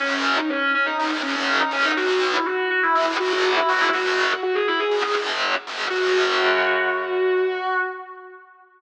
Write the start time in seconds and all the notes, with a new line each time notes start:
0.00 F#2 C#3 F#3 C#4
0.37 D#4
0.49 C#4
0.74 C#4
0.86 D#4
0.99 F#2 C#3 F#3 D#4
1.11 F#2 C#3 F#3
1.23 F#2 C#3 F#3 C#4
1.35 C#4
1.60 D#4
1.71 F#2 C#3 F#3 C#4
1.84 D#4
1.97 B1 B2 F#3 F#4
2.33 E4
2.45 F#4
2.70 F#4
2.83 E4
2.95 G#2 D#3 G#3 E4
3.06 G#2 D#3 G#3
3.20 G#2 D#3 G#3 F#4
3.32 F#4
3.56 E4
3.69 G#2 D#3 G#3 F#4
3.81 E4
3.93 F#2 C#3 F#3 F#4
4.43 F#4
4.55 G#4
4.68 E4
4.79 G#4
4.91 F#2 C#3 F#3
5.04 F#2 C#3 F#3
5.16 F#2 C#3 F#3
5.67 F#2 C#3 F#3
5.90 F#2 C#3 F#3 F#4